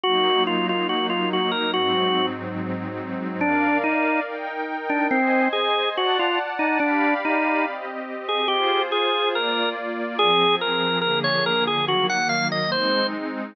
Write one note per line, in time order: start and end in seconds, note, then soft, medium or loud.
0.04 1.72 F#3 loud
0.04 1.72 A#3 medium
0.04 1.72 D#4 medium
0.04 0.43 F#4 loud
0.47 0.67 F4 medium
0.69 0.87 F4 medium
0.89 1.07 F#4 medium
1.10 1.29 F4 medium
1.33 1.51 F#4 medium
1.51 1.71 A#4 medium
1.74 3.41 G#2 medium
1.74 3.41 F#3 loud
1.74 3.41 C4 medium
1.74 3.41 D#4 medium
1.74 2.26 F#4 loud
3.41 3.78 D4 loud
3.41 4.26 A#4 medium
3.41 4.26 D5 medium
3.41 4.26 F5 medium
3.84 4.20 D#4 loud
4.27 5.11 D#4 medium
4.27 5.11 A#4 medium
4.27 5.11 G5 medium
4.90 5.07 D4 loud
5.11 5.48 C4 loud
5.11 5.95 C5 medium
5.11 5.95 D#5 medium
5.11 5.95 G#5 medium
5.53 5.89 G#4 loud
5.96 6.18 F#4 loud
5.96 6.80 D5 medium
5.96 6.80 F#5 loud
5.96 6.80 A5 medium
6.19 6.39 F4 loud
6.59 6.78 D#4 loud
6.80 7.14 D4 loud
6.80 7.64 G4 medium
6.80 7.64 D5 medium
6.80 7.64 F5 medium
6.80 7.64 B5 medium
7.25 7.65 D#4 loud
7.65 8.49 C4 medium
7.65 8.49 G4 medium
7.65 8.49 D#5 medium
8.29 8.48 G#4 loud
8.48 9.33 F4 loud
8.48 8.82 G4 loud
8.48 9.33 G#4 loud
8.48 9.33 C5 loud
8.92 9.29 G#4 loud
9.34 10.18 A#3 medium
9.34 10.18 F4 loud
9.34 9.69 A#4 medium
9.34 10.18 D5 loud
10.19 11.02 F3 loud
10.19 11.02 C4 medium
10.19 10.55 G#4 loud
10.19 11.02 G#4 medium
10.61 10.99 A#4 medium
11.01 11.87 D3 medium
11.01 11.87 F3 medium
11.01 11.87 A#3 medium
11.01 11.87 G#4 medium
11.01 11.19 A#4 loud
11.24 11.45 C#5 loud
11.46 11.64 A#4 loud
11.67 11.85 G#4 loud
11.88 12.71 D#3 medium
11.88 12.71 F#3 medium
11.88 12.71 A#3 medium
11.88 12.07 F#4 loud
12.09 12.28 F#5 loud
12.29 12.48 F5 loud
12.52 12.71 D#5 medium
12.72 13.55 G#3 loud
12.72 13.55 C4 medium
12.72 13.55 D#4 loud
12.72 13.07 C5 loud